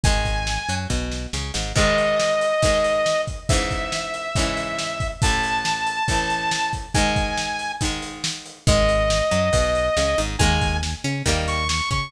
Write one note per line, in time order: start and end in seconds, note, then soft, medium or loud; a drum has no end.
0.04 0.59 G#1 loud
0.04 0.63 D#3 medium
0.04 0.63 G#3 medium
0.04 0.75 G#5 medium
0.04 kick loud
0.04 closed hi-hat loud
0.25 kick medium
0.25 closed hi-hat medium
0.47 snare medium
0.69 0.87 F#2 medium
0.69 0.88 F#3 medium
0.69 closed hi-hat medium
0.90 1.27 B1 medium
0.90 1.27 B2 medium
0.90 kick medium
0.90 snare medium
1.12 snare medium
1.33 1.51 C#2 medium
1.33 1.52 C#3 medium
1.33 snare medium
1.54 1.73 G#1 medium
1.54 1.72 G#2 medium
1.54 snare medium
1.76 2.53 G#2 medium
1.76 2.53 D#3 medium
1.76 2.53 G#3 medium
1.76 3.21 D#5 medium
1.76 kick medium
1.76 crash loud
1.98 closed hi-hat medium
2.20 snare medium
2.41 closed hi-hat medium
2.62 3.40 G#2 medium
2.62 3.40 D#3 medium
2.62 3.40 G#3 medium
2.62 kick medium
2.62 closed hi-hat loud
2.84 closed hi-hat medium
3.06 snare medium
3.27 kick medium
3.27 closed hi-hat medium
3.49 4.28 G#2 medium
3.49 4.28 C#3 medium
3.49 5.08 E5 medium
3.49 kick loud
3.49 closed hi-hat loud
3.53 4.28 E3 medium
3.71 kick medium
3.71 closed hi-hat medium
3.92 snare medium
4.14 closed hi-hat medium
4.35 5.14 G#2 medium
4.35 5.14 C#3 medium
4.35 5.14 E3 medium
4.35 kick medium
4.35 closed hi-hat medium
4.57 closed hi-hat medium
4.79 snare medium
5.00 kick medium
5.00 closed hi-hat medium
5.22 6.00 A1 medium
5.22 6.00 A2 medium
5.22 6.00 E3 medium
5.22 6.69 A5 medium
5.22 kick loud
5.22 closed hi-hat loud
5.43 closed hi-hat medium
5.65 snare loud
5.87 closed hi-hat medium
6.08 6.86 A1 medium
6.08 6.86 A2 medium
6.08 6.86 E3 medium
6.08 kick medium
6.08 closed hi-hat medium
6.30 closed hi-hat medium
6.51 snare loud
6.73 kick medium
6.73 closed hi-hat medium
6.94 7.72 G#2 medium
6.94 7.72 D#3 medium
6.94 7.72 G#3 medium
6.94 7.72 G#5 medium
6.94 kick medium
6.94 closed hi-hat medium
7.16 kick medium
7.16 closed hi-hat medium
7.38 snare medium
7.59 closed hi-hat medium
7.81 8.59 G#2 medium
7.81 8.59 D#3 medium
7.81 8.59 G#3 medium
7.81 kick medium
7.81 closed hi-hat loud
8.02 closed hi-hat medium
8.24 snare loud
8.46 closed hi-hat medium
8.67 9.22 G#1 loud
8.67 9.25 D#3 loud
8.67 9.25 G#3 loud
8.67 10.21 D#5 medium
8.67 kick loud
8.67 closed hi-hat medium
8.89 closed hi-hat medium
9.10 snare loud
9.31 9.50 F#2 medium
9.31 9.50 F#3 medium
9.31 closed hi-hat medium
9.53 9.89 B1 medium
9.53 9.89 B2 medium
9.53 kick medium
9.53 closed hi-hat loud
9.75 closed hi-hat medium
9.97 10.15 C#2 medium
9.97 10.15 C#3 medium
9.97 snare medium
10.18 10.37 G#1 medium
10.18 10.36 G#2 medium
10.18 closed hi-hat medium
10.39 10.95 D#2 loud
10.39 10.78 D#3 loud
10.39 10.78 G#3 loud
10.39 10.78 A#3 loud
10.39 10.77 G#5 medium
10.39 kick medium
10.39 closed hi-hat medium
10.61 kick medium
10.61 closed hi-hat medium
10.83 snare medium
11.04 11.22 C#3 loud
11.04 11.23 C#4 medium
11.04 closed hi-hat medium
11.26 11.81 D#2 loud
11.26 11.64 D#3 loud
11.26 11.64 G3 loud
11.26 11.64 A#3 loud
11.26 kick medium
11.26 closed hi-hat medium
11.48 11.68 C#6 medium
11.48 closed hi-hat medium
11.69 11.89 C#6 medium
11.69 snare loud
11.91 12.09 C#3 medium
11.91 12.09 C#4 medium
11.91 12.10 C#6 medium
11.91 kick medium
11.91 closed hi-hat medium